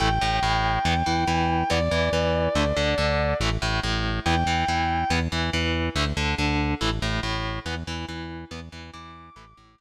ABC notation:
X:1
M:4/4
L:1/8
Q:1/4=141
K:Am
V:1 name="Distortion Guitar"
g8 | d8 | z4 g4 | z8 |
z8 | z2 d'6 |]
V:2 name="Overdriven Guitar"
[E,A,] A,, A,,2 [E,B,] E, E,2 | [E,B,] E, E,2 [D,A,] D, D,2 | [E,A,] A,, A,,2 [E,B,] E, E,2 | [E,B,] E, E,2 [D,A,] D, D,2 |
[E,A,] A,, A,,2 [E,B,] E, E,2 | [E,B,] E, E,2 [E,A,] A,, A,,2 |]
V:3 name="Synth Bass 1" clef=bass
A,,, A,,, A,,,2 E,, E,, E,,2 | E,, E,, E,,2 D,, D,, D,,2 | A,,, A,,, A,,,2 E,, E,, E,,2 | E,, E,, E,,2 D,, D,, D,,2 |
A,,, A,,, A,,,2 E,, E,, E,,2 | E,, E,, E,,2 A,,, A,,, A,,,2 |]